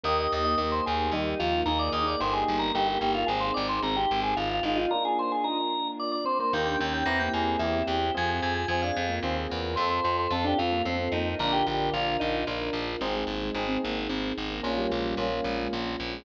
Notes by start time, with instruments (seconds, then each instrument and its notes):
0.03 electric bass (finger) D#2, drawbar organ A#3 D#5, electric piano 1 A#3 D#4 G4, string ensemble 1 A#3 D#4 G4
0.20 drawbar organ D#5
0.32 electric bass (finger) D#2, drawbar organ D#5
0.44 drawbar organ A#3 D#5
0.58 electric bass (finger) D#2, drawbar organ A#3 D#5, electric piano 1 A#3 D#4 G4
0.72 drawbar organ C5
0.86 electric bass (finger) D#2, drawbar organ G#4
1.12 electric bass (finger) D#2, drawbar organ G3 D#4, electric piano 1 A#3 D#4 G4
1.39 electric bass (finger) D#2, drawbar organ F3 F4
1.66 electric bass (finger) D#2, electric piano 1 A#3 D#4 G#4, string ensemble 1 A#3 D#4 G#4, drawbar organ D#4 A#4
1.79 drawbar organ D5
1.92 electric bass (finger) D#2, drawbar organ D#5
2.06 drawbar organ D#4 D5
2.20 electric bass (finger) G1, electric piano 1 A#3 D#4 G4, string ensemble 1 A#3 D#4 G4, drawbar organ D#4 C5
2.33 drawbar organ G#4
2.48 electric bass (finger) G1
2.59 drawbar organ A#4
2.74 electric bass (finger) G1, drawbar organ A#3 G4, electric piano 1 A#3 D#4 G4
2.88 drawbar organ G4
2.99 electric bass (finger) G1, drawbar organ A#3 G4
3.15 drawbar organ F4
3.26 electric bass (finger) G#1, electric piano 1 C4 D#4 G#4, string ensemble 1 C4 D#4 G#4, drawbar organ G#4
3.40 drawbar organ C5
3.54 electric bass (finger) G#1, drawbar organ D5
3.69 drawbar organ C5
3.82 electric bass (finger) G#1, drawbar organ C4 A#4
3.96 drawbar organ G4
4.11 electric bass (finger) G#1
4.23 drawbar organ G#4
4.36 electric bass (finger) G#1, drawbar organ F4
4.51 drawbar organ F4
4.63 electric bass (finger) G#1, drawbar organ D#4 F4
4.76 drawbar organ D#4 F4
4.91 electric piano 1 A#3 D4 F4, string ensemble 1 A#3 D4 F4, drawbar organ A#4
5.05 drawbar organ G#4
5.19 drawbar organ C5
5.32 drawbar organ G#4
5.44 drawbar organ D#4 A#4
5.99 drawbar organ D5
6.12 drawbar organ D5
6.25 drawbar organ C4 C5
6.39 drawbar organ A#3 C5
6.53 electric bass (finger) D#2, electric piano 1 A#3 D#4 G4, drawbar organ A#3 G5, string ensemble 1 A#3 D#4 G4
6.66 drawbar organ D4 G5
6.79 electric bass (finger) D#2, drawbar organ C#4 G5
6.94 drawbar organ G5
7.06 electric bass (finger) E2, string ensemble 1 C4 E4 G4, electric piano 1 C4 E4 G4, drawbar organ C4 A#5
7.19 drawbar organ A#3 G5
7.34 electric bass (finger) E2, drawbar organ G#4
7.59 electric bass (finger) E2, electric piano 1 C4 E4 G4, drawbar organ E4
7.87 electric bass (finger) E2, drawbar organ G4
8.14 electric bass (finger) F2, string ensemble 1 C4 F4 G#4, electric piano 1 C4 F4 G#4, drawbar organ G#5
8.29 drawbar organ G#5
8.42 electric bass (finger) F2, drawbar organ G#5
8.55 drawbar organ G#5
8.68 electric bass (finger) F2, electric piano 1 C4 F4 G#4, drawbar organ C4 G#5
8.82 drawbar organ D4 F5
8.97 electric bass (finger) F2, drawbar organ C4
9.09 drawbar organ A#3
9.23 electric bass (finger) D#2, electric piano 1 C4 F4 G#4, drawbar organ C4
9.50 electric bass (finger) E2, drawbar organ A#3
9.76 electric bass (finger) F2, electric piano 1 C4 F4 A4, string ensemble 1 C4 F4 A4, drawbar organ C5
9.90 drawbar organ C5
10.04 electric bass (finger) F2, drawbar organ C5
10.19 drawbar organ C5
10.31 electric bass (finger) F2, electric piano 1 C4 F4 A4, drawbar organ C4 A4
10.44 drawbar organ D4 G4
10.58 electric bass (finger) F2, drawbar organ C4 F4
10.72 drawbar organ A#3
10.85 electric bass (finger) F2, drawbar organ C4, electric piano 1 C4 F4 A4
11.12 electric bass (finger) F2, drawbar organ A#3 D#4
11.39 electric bass (finger) A#1, drawbar organ D3 A#4, string ensemble 1 D4 F4 A#4, electric piano 1 D4 F4 A#4
11.53 drawbar organ G4
11.66 electric bass (finger) A#1, drawbar organ D3 G4
11.93 electric bass (finger) A#1, drawbar organ D3 F4, electric piano 1 D4 F4 A#4
12.20 electric bass (finger) A#1, drawbar organ D#4
12.47 electric bass (finger) A#1, electric piano 1 D4 F4 A#4
12.73 electric bass (finger) A#1
13.01 electric bass (finger) G#1, drawbar organ C4, electric piano 1 C4 D#4 G#4, string ensemble 1 C4 D#4 G#4
13.16 drawbar organ G#3
13.27 electric bass (finger) G#1, drawbar organ A#3
13.43 drawbar organ G#3
13.55 electric bass (finger) G#1, electric piano 1 C4 D#4 G#4
13.68 drawbar organ C4
13.83 electric bass (finger) G#1, drawbar organ A#3
13.97 drawbar organ A#3
14.09 electric bass (finger) G#1, drawbar organ C4
14.38 electric bass (finger) G#1
14.51 drawbar organ A#3
14.63 electric bass (finger) A#1, electric piano 1 A#3 C#4 F4, string ensemble 1 A#3 C#4 F4, drawbar organ A#3
14.78 drawbar organ G3
14.90 electric bass (finger) A#1, drawbar organ G#3
15.05 drawbar organ G3
15.17 electric bass (finger) A#1, electric piano 1 A#3 C#4 F4
15.31 drawbar organ A#3
15.44 electric bass (finger) A#1, drawbar organ G#3
15.58 drawbar organ G#3
15.71 electric bass (finger) A#1, drawbar organ A#3
16.00 electric bass (finger) A#1
16.13 drawbar organ G#3